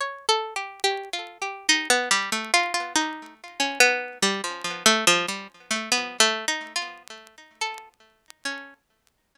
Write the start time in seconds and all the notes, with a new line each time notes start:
0.01 C#5
0.29 A4
0.56 G4
0.84 G4
1.13 F4
1.42 G4
1.69 D#4
1.90 B3
2.11 G3
2.32 A3
2.54 F4
2.74 F4
2.96 D#4
3.60 C#4
3.80 B3
4.22 G3
4.44 F3
4.64 F3
4.86 A3
5.07 F3
5.28 G3
5.71 A3
5.92 B3
6.20 A3
6.48 D#4
6.76 F4
7.61 A4
8.45 C#4